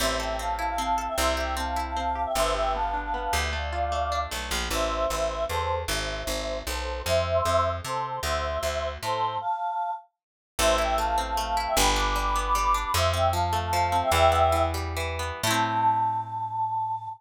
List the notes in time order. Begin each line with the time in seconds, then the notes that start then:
0.00 A1 C4 C5 E5
0.20 A4 E5 G5
0.39 C4 F5 A5
0.59 E4
0.68 F5 A5
0.78 C4 F5 A5
0.98 A4
1.08 E5 G5
1.18 C2 C4 C5 E5
1.37 G4 E5 G5
1.57 C4 F5 A5
1.76 E4
1.86 F5 A5
1.96 C4 F5 A5
2.15 G4
2.25 E5 G5
2.35 G1 B3 C5 E5
2.55 G4 E5 G5
2.74 B3 F5 A5
2.94 D4
3.04 F5 A5
3.14 B3 F5 A5
3.33 D2 G4
3.43 E5 G5
3.53 A3 D5 F5
3.73 F4
3.92 A3
4.12 D4
4.31 B1 A3
4.51 A#1 F4
4.70 A1 C5 E5
5.10 A1
5.49 E2 A4 C5
5.88 G#1 C5 E5
6.27 G#1
6.66 B1 A4 C5
7.06 F2 C5 E5
7.45 F2
7.84 C3 A4 C5
8.23 D2 C5 E5
8.63 D2
9.02 A2 A4 C5
9.41 F5 A5
10.59 A1 A3 C5 E5
10.78 E4 E5 G5
10.98 A3 F5 A5
11.18 C4
11.27 F5 A5
11.37 A3 F5 A5
11.57 E4
11.67 E5 G5
11.76 G1 G3 G5 B5
11.96 D4 B5 D6
12.16 G3 B5 D6
12.36 B3
12.45 B5 D6
12.55 G3 B5 D6
12.74 D4
12.84 B5 D6
12.94 F2 F3 C5 E5
13.13 C4 E5 G5
13.33 F3 F5 A5
13.53 A3
13.63 F5 A5
13.73 F3 F5 A5
13.92 C4
14.02 E5 G5
14.12 E2 E3 E5 G5
14.32 B3
14.52 E3
14.74 G3
14.97 E3
15.19 B3
15.43 A2 E4 A4 A5
15.50 C4